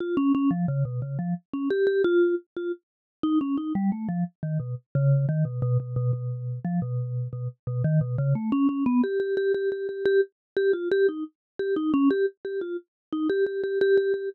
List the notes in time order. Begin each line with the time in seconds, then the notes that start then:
0.00 F4
0.17 C#4
0.35 C#4
0.51 F3
0.68 C#3
0.85 B2
1.02 C#3
1.19 F3
1.53 C#4
1.70 G4
1.87 G4
2.04 F4
2.57 F4
3.23 D#4
3.41 C#4
3.58 D#4
3.75 G3
3.92 A3
4.09 F3
4.43 D#3
4.60 B2
4.95 C#3
5.29 D#3
5.45 B2
5.62 B2
5.80 B2
5.96 B2
6.13 B2
6.65 F3
6.82 B2
7.33 B2
7.67 B2
7.84 D#3
8.01 B2
8.18 C#3
8.35 A3
8.52 C#4
8.69 C#4
8.86 B3
9.04 G4
9.20 G4
9.37 G4
9.54 G4
9.72 G4
9.89 G4
10.06 G4
10.57 G4
10.73 F4
10.91 G4
11.09 D#4
11.59 G4
11.76 D#4
11.94 C#4
12.11 G4
12.45 G4
12.61 F4
13.12 D#4
13.30 G4
13.46 G4
13.64 G4
13.81 G4
13.97 G4
14.14 G4